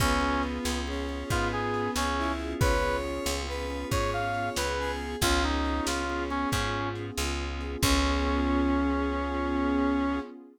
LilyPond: <<
  \new Staff \with { instrumentName = "Brass Section" } { \time 12/8 \key des \major \tempo 4. = 92 des'4 r2 f'8 aes'4 des'4 r8 | ces''4 r2 des''8 f''4 ces''4 r8 | f'8 ees'4 f'4 des'8 des'4 r2 | des'1. | }
  \new Staff \with { instrumentName = "Lead 1 (square)" } { \time 12/8 \key des \major ces'2 des'4 ces'2 e'4 | des''2 ces''4 des''2 aes'4 | des'1 r2 | des'1. | }
  \new Staff \with { instrumentName = "Drawbar Organ" } { \time 12/8 \key des \major <ces' des' f' aes'>8 <ces' des' f' aes'>4. <ces' des' f' aes'>8 <ces' des' f' aes'>2 <ces' des' f' aes'>4.~ | <ces' des' f' aes'>8 <ces' des' f' aes'>4. <ces' des' f' aes'>8 <ces' des' f' aes'>2 <ces' des' f' aes'>4. | <ces' des' f' aes'>8 <ces' des' f' aes'>4. <ces' des' f' aes'>8 <ces' des' f' aes'>2 <ces' des' f' aes'>4. | <ces' des' f' aes'>1. | }
  \new Staff \with { instrumentName = "Electric Bass (finger)" } { \clef bass \time 12/8 \key des \major des,4. des,4. aes,4. des,4. | des,4. des,4. aes,4. des,4. | des,4. des,4. aes,4. des,4. | des,1. | }
  \new Staff \with { instrumentName = "Pad 2 (warm)" } { \time 12/8 \key des \major <ces' des' f' aes'>1.~ | <ces' des' f' aes'>1. | <ces' des' f' aes'>1. | <ces' des' f' aes'>1. | }
  \new DrumStaff \with { instrumentName = "Drums" } \drummode { \time 12/8 <hh bd>4 hh8 sn4 hh8 <hh bd>4 hh8 sn4 hh8 | <hh bd>4 hh8 sn4 hh8 <hh bd>4 hh8 sn4 hh8 | <hh bd>4 hh8 sn4 hh8 <hh bd>4 hh8 sn4 hh8 | <cymc bd>4. r4. r4. r4. | }
>>